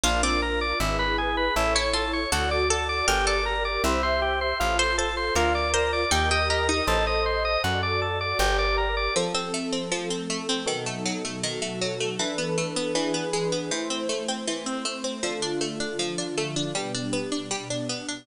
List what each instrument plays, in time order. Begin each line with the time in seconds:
0.04 electric bass (finger) A#1, harpsichord D4, electric piano 1 D4, pad 2 (warm) D4 F4 A#4, drawbar organ F4
0.23 harpsichord C4, drawbar organ D5
0.42 drawbar organ A#4, electric piano 1 A#4
0.61 drawbar organ D5
0.80 electric bass (finger) G#1, pad 2 (warm) E4 G#4 B4, drawbar organ E4, electric piano 1 E4
0.99 drawbar organ B4
1.18 electric piano 1 G#4, drawbar organ G#4
1.37 drawbar organ B4
1.56 electric bass (finger) A1, electric piano 1 E4 A4 C#5, pad 2 (warm) E4 A4 C#5, drawbar organ E4
1.75 harpsichord E4, drawbar organ C#5
1.94 harpsichord F4, drawbar organ A4
2.13 drawbar organ C#5
2.32 electric bass (finger) D2, drawbar organ F#4, pad 2 (warm) F#4 A4 D5, electric piano 1 F#4, harpsichord A4
2.51 drawbar organ D5
2.70 drawbar organ A4, harpsichord A4, electric piano 1 D5
2.89 drawbar organ D5
3.07 electric bass (finger) G1, electric piano 1 G4, drawbar organ G4, pad 2 (warm) G4 A#4 D5, harpsichord A#4
3.27 harpsichord A4, drawbar organ D5
3.45 electric piano 1 A#4, drawbar organ A#4
3.65 drawbar organ D5
3.84 electric bass (finger) C2, drawbar organ E4, pad 2 (warm) G4 C5 E5, electric piano 1 G4 C5 E5
4.03 drawbar organ C5
4.22 drawbar organ G4
4.41 drawbar organ C5
4.60 electric bass (finger) A1, pad 2 (warm) F4 A4 C5, drawbar organ F4, electric piano 1 F4
4.79 drawbar organ C5, harpsichord C5
4.98 drawbar organ A4, electric piano 1 A4, harpsichord C5
5.17 drawbar organ C5
5.35 electric bass (finger) D2, pad 2 (warm) F4 A#4 D5, electric piano 1 F4 A#4 D5, drawbar organ F4, harpsichord A#4
5.55 drawbar organ D5
5.74 drawbar organ A#4, harpsichord C5
5.93 drawbar organ D5
6.11 electric bass (finger) D#2, harpsichord D#4, drawbar organ G4, electric piano 1 G4, pad 2 (warm) G4 A#4 D#5
6.31 harpsichord G4, drawbar organ D#5
6.50 harpsichord G4, drawbar organ A#4, electric piano 1 D#5
6.69 harpsichord D#4, drawbar organ D#5
6.87 electric bass (finger) A1, electric piano 1 A4 C5 D#5, pad 2 (warm) A4 C5 D#5, drawbar organ A4
7.07 drawbar organ D#5
7.26 drawbar organ C5
7.45 drawbar organ D#5
7.64 electric bass (finger) F#2, drawbar organ F#4, pad 2 (warm) F#4 A4 D5, electric piano 1 F#4
7.83 drawbar organ D5
8.02 drawbar organ A4, electric piano 1 D5
8.21 drawbar organ D5
8.39 electric bass (finger) G1, drawbar organ G4, electric piano 1 G4, pad 2 (warm) G4 A#4 D5
8.59 drawbar organ D5
8.77 electric piano 1 A#4, drawbar organ A#4
8.97 drawbar organ D5
9.15 pad 2 (warm) F3 C4 A4, harpsichord F3, electric piano 1 F3 C4 A4
9.34 harpsichord C4
9.54 harpsichord A3
9.73 harpsichord C4
9.92 harpsichord F3, pad 2 (warm) F3 A3 A4
10.10 harpsichord C4
10.30 harpsichord A3
10.49 harpsichord C4
10.66 pad 2 (warm) B2 F#3 D#4 A4, harpsichord D#3, electric piano 1 B3 D#4 F#4 A4
10.86 harpsichord A3
11.06 harpsichord F#3
11.25 harpsichord A3
11.42 pad 2 (warm) B2 F#3 F#4 A4, harpsichord D#3
11.62 harpsichord A3
11.81 harpsichord F#3
12.00 harpsichord A3
12.19 harpsichord E3, electric piano 1 E3 D4 A4 B4, pad 2 (warm) E3 D4 A4 B4
12.38 harpsichord B3
12.58 harpsichord A3
12.76 harpsichord B3
12.95 electric piano 1 E3 D4 G#4 B4, harpsichord E3, pad 2 (warm) E3 D4 G#4 B4
13.14 harpsichord B3
13.33 harpsichord G#3
13.52 harpsichord B3
13.71 harpsichord E3, pad 2 (warm) A3 E4 C5, electric piano 1 A3 E4 C5
13.90 harpsichord C4
14.09 harpsichord A3
14.28 harpsichord C4
14.46 harpsichord E3, pad 2 (warm) A3 C4 C5
14.66 harpsichord C4
14.85 harpsichord A3
15.04 harpsichord C4
15.23 pad 2 (warm) D3 A3 F4, harpsichord F3, electric piano 1 D4 F4 A4
15.42 harpsichord D4
15.61 harpsichord A3
15.80 harpsichord D4
15.99 pad 2 (warm) D3 F3 F4, harpsichord F3
16.18 harpsichord D4
16.38 harpsichord A3
16.56 harpsichord D4
16.74 pad 2 (warm) B2 G3 D4, harpsichord G3, electric piano 1 B3 D4 G4
16.95 harpsichord D4
17.13 harpsichord B3
17.32 harpsichord D4
17.51 pad 2 (warm) B2 B3 D4, harpsichord G3
17.70 harpsichord D4
17.89 harpsichord B3
18.09 harpsichord D4